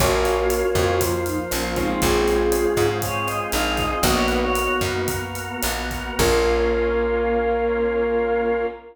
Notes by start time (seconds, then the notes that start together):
0.00 A#1 A#3 C#4 F4 F#4 A#4 C#5, kick, cross-stick, closed hi-hat
0.25 closed hi-hat
0.50 closed hi-hat
0.75 F2 A#3 C#4 F4 C5, kick, cross-stick, closed hi-hat
1.01 F3 A#3 F4, kick, closed hi-hat
1.26 D#4, closed hi-hat
1.51 A#1 C#4, cross-stick, closed hi-hat
1.76 G#3 C4 C#4 D#4 F4, kick, closed hi-hat
1.90 D#4
2.02 A#1 G#3 C4 C#4 F4 G#4, kick, closed hi-hat
2.28 closed hi-hat
2.52 cross-stick, closed hi-hat
2.77 G#2, kick, closed hi-hat
3.02 G#3 C4 F4 G#4 C#5, kick, closed hi-hat
3.27 D#5, cross-stick, closed hi-hat
3.51 A#1 D#4 F5, closed hi-hat
3.77 D#5, kick, closed hi-hat
3.90 D#5
4.02 A#1 A#3 B3 D#4 F#4 D#5, kick, cross-stick, closed hi-hat
4.14 C#5
4.28 B4, closed hi-hat
4.40 C#5
4.55 closed hi-hat
4.81 F#2, kick, cross-stick, closed hi-hat
5.08 A#3 B3 F#4 A#4, kick, closed hi-hat
5.35 closed hi-hat
5.62 A#1, cross-stick, closed hi-hat
5.91 kick, closed hi-hat
6.18 A#1 A#3 C#4 F4 A#4, kick, crash